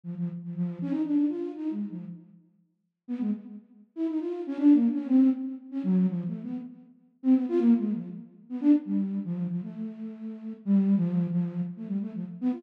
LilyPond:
\new Staff { \time 4/4 \partial 4 \tempo 4 = 119 f16 f16 r16 f16 | f8 des'16 ees'16 d'8 f'8 \tuplet 3/2 { ees'8 aes8 f8 } r4 | r4 b16 aes16 r4 r16 e'16 ees'16 f'8 des'16 | \tuplet 3/2 { d'8 bes8 des'8 } c'8 r8. des'16 ges8 \tuplet 3/2 { f8 a8 b8 } |
r4 r16 c'16 b16 f'16 \tuplet 3/2 { bes8 aes8 f8 } r8. b16 | d'16 r16 g8. f8 f16 a2 | \tuplet 3/2 { g4 f4 f4 } r16 a16 g16 a16 f16 r16 b16 f'16 | }